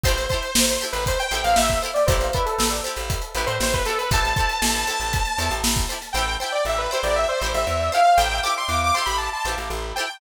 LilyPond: <<
  \new Staff \with { instrumentName = "Lead 2 (sawtooth)" } { \time 4/4 \key a \minor \tempo 4 = 118 c''8 c''8. c''16 r16 b'16 c''16 g''8 f''16 e''8 r16 d''16 | c''8 b'16 a'8 r4 r16 b'16 c''16 c''16 b'16 a'16 b'16 | a''2. r4 | g''8 g''16 d''16 e''16 b'16 c''16 d''16 e''16 c''8 e''8. f''8 |
g''8 d'''16 c'''16 d'''16 d'''16 c'''16 b''16 a''16 a''8 r8. g''8 | }
  \new Staff \with { instrumentName = "Pizzicato Strings" } { \time 4/4 \key a \minor <e' g' a' c''>8 <e' g' a' c''>4 <e' g' a' c''>4 <e' g' a' c''>4 <e' g' a' c''>8 | <e' g' a' c''>8 <e' g' a' c''>4 <e' g' a' c''>4 <e' g' a' c''>4 <e' g' a' c''>8 | <e' g' a' c''>8 <e' g' a' c''>4 <e' g' a' c''>4 <e' g' a' c''>4 <e' g' a' c''>8 | <e' g' a' c''>8 <e' g' a' c''>4 <e' g' a' c''>4 <e' g' a' c''>4 <e' g' a' c''>8 |
<e' g' a' c''>8 <e' g' a' c''>4 <e' g' a' c''>4 <e' g' a' c''>4 <e' g' a' c''>8 | }
  \new Staff \with { instrumentName = "Electric Bass (finger)" } { \clef bass \time 4/4 \key a \minor a,,4 a,,8. a,,8. a,,16 a,,16 a,,4 | a,,4 a,,8. a,,8. a,,16 a,16 a,,4 | a,,4 a,,8. a,,8. e,16 a,,16 a,,4 | a,,4 a,,8. a,,8. a,,16 a,,16 e,4 |
a,,4 e,8. a,,8. a,,16 a,,16 a,,4 | }
  \new DrumStaff \with { instrumentName = "Drums" } \drummode { \time 4/4 <hh bd>16 <hh sn>16 <hh bd>16 hh16 sn16 hh16 hh16 hh16 <hh bd>16 hh16 hh16 hh16 sn16 <hh bd sn>16 hh16 <hh sn>16 | <hh bd>16 <hh sn>16 <hh bd>16 hh16 sn16 hh16 hh16 hh16 <hh bd>16 hh16 <hh sn>16 hh16 sn16 <hh bd>16 <hh sn>16 hh16 | <hh bd>16 <hh sn>16 <hh bd>16 hh16 sn16 hh16 hh16 hh16 <hh bd>16 <hh sn>16 hh16 hh16 sn16 <hh bd>16 hh16 <hh sn>16 | r4 r4 r4 r4 |
r4 r4 r4 r4 | }
>>